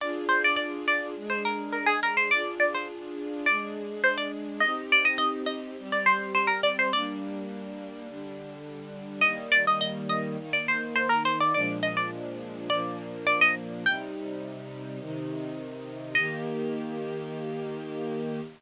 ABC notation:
X:1
M:4/4
L:1/16
Q:1/4=104
K:Eb
V:1 name="Pizzicato Strings"
d2 c d d2 d2 z c B2 B A B c | d2 d c z4 d4 c d z2 | e2 d e e2 e2 z d c2 c B d c | d10 z6 |
e2 d e e2 e2 z d c2 c B c d | d2 e d z4 d4 d e z2 | g10 z6 | e16 |]
V:2 name="String Ensemble 1"
[DFA]8 [A,DA]8 | [DFA]8 [A,DA]8 | [CEG]8 [G,CG]8 | [G,B,D]8 [D,G,D]8 |
[E,G,B,]8 [E,B,E]8 | [B,,F,A,D]8 [B,,F,B,D]8 | [C,G,E]8 [C,E,E]8 | [E,B,G]16 |]